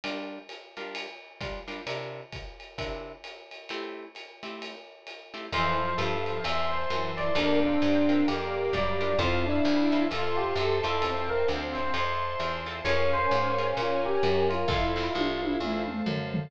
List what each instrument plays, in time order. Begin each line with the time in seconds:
0.04 acoustic guitar (steel) G3 D4 F4 A#4, ride
0.49 hi-hat pedal, ride
0.77 acoustic guitar (steel) G3 D4 F4 A#4, ride
0.95 ride
1.41 acoustic guitar (steel) G3 D4 F4 A#4, kick, hi-hat pedal, ride
1.68 acoustic guitar (steel) G3 D4 F4 A#4, ride
1.87 acoustic guitar (steel) C3 D4 E4 A#4, ride
2.33 kick, hi-hat pedal, ride
2.60 ride
2.78 acoustic guitar (steel) C3 D4 E4 A#4, kick, ride
3.24 hi-hat pedal, ride
3.51 ride
3.69 acoustic guitar (steel) A3 C4 E4 G4, ride
4.15 hi-hat pedal, ride
4.43 acoustic guitar (steel) A3 C4 E4 G4, ride
4.62 ride
5.07 hi-hat pedal, ride
5.34 acoustic guitar (steel) A3 C4 E4 G4, ride
5.52 electric bass (finger) F2, lead 1 (square) E3, acoustic guitar (steel) C4 E4 F4 A4, electric piano 1 C5, string ensemble 1 C5 E5 F5 A5, ride
5.80 lead 1 (square) F3
5.98 electric bass (finger) G2, electric piano 1 A4, hi-hat pedal, ride
6.26 lead 1 (square) F3, ride
6.44 electric bass (finger) E2, string ensemble 1 C5 E5 A5 C6, electric piano 1 E5, ride
6.71 electric piano 1 C5
6.90 electric bass (finger) F#2, lead 1 (square) E3, hi-hat pedal, ride
7.17 electric piano 1 D5, ride
7.35 electric bass (finger) F2, lead 1 (square) A#3, acoustic guitar (steel) D4 F4 G4 A#4, electric piano 1 D4, string ensemble 1 D5 F5 G5 A#5, ride
7.63 lead 1 (square) C4, electric piano 1 D4
7.82 electric bass (finger) G2, hi-hat pedal, ride
8.09 acoustic guitar (steel) D4 F4 G4 A#4, ride
8.28 electric bass (finger) F2, lead 1 (square) A#3, electric piano 1 G4, string ensemble 1 D5 F5 A#5 D6, ride
8.73 electric bass (finger) F#2, lead 1 (square) G3, electric piano 1 D5, kick, hi-hat pedal, ride
9.01 acoustic guitar (steel) D4 F4 G4 A#4, ride
9.19 electric bass (finger) F2, electric piano 1 C4, acoustic guitar (steel) C4 E4 F4 A4, lead 1 (square) F4, string ensemble 1 C5 E5 F5 A5, kick, ride
9.46 electric piano 1 D4, lead 1 (square) E4
9.65 electric bass (finger) D2, hi-hat pedal, ride
9.92 acoustic guitar (steel) C4 E4 F4 A4, ride
10.10 electric bass (finger) F2, lead 1 (square) F4, electric piano 1 A4, string ensemble 1 C5 E5 A5 C6, ride
10.37 electric piano 1 G4
10.56 electric bass (finger) F#2, lead 1 (square) A4, hi-hat pedal, ride
10.83 electric bass (finger) F2, acoustic guitar (steel) C4 E4 F4 A4, electric piano 1 A4, ride
11.01 lead 1 (square) C4, electric piano 1 A4, string ensemble 1 C5 E5 F5 A5, ride
11.29 electric piano 1 A#4
11.48 electric bass (finger) D2, hi-hat pedal, ride
11.75 electric piano 1 C5, ride
11.94 electric bass (finger) F2, electric piano 1 C5, string ensemble 1 C5 E5 A5 C6, ride
12.39 electric bass (finger) E2, hi-hat pedal, ride
12.66 acoustic guitar (steel) C4 E4 F4 A4, ride
12.84 electric bass (finger) F2, acoustic guitar (steel) C#4 F4 G#4 A#4, lead 1 (square) C#4, string ensemble 1 A#4 C#5 F5 G#5, electric piano 1 C#5, ride
13.13 electric piano 1 C5
13.31 electric bass (finger) G#2, hi-hat pedal, ride
13.58 acoustic guitar (steel) C#4 F4 G#4 A#4, ride
13.77 electric bass (finger) A#2, electric piano 1 F4, string ensemble 1 A#4 C#5 G#5 A#5, ride
14.06 electric piano 1 G4
14.23 electric bass (finger) F#2, hi-hat pedal, ride
14.49 electric piano 1 F4, ride
14.68 electric bass (finger) F2, acoustic guitar (steel) C4 E4 F4 A4, lead 1 (square) E4, electric piano 1 F4, string ensemble 1 A4 C5 E5 F5, kick, snare
14.96 acoustic guitar (steel) C4 E4 F4 A4, snare
15.15 electric bass (finger) C2, lead 1 (square) F4, high tom
15.42 lead 1 (square) E4, high tom
15.60 electric bass (finger) E2, lead 1 (square) E4, string ensemble 1 A4 C5 F5 A5, mid tom
15.88 mid tom
16.06 electric bass (finger) F#2, floor tom
16.34 floor tom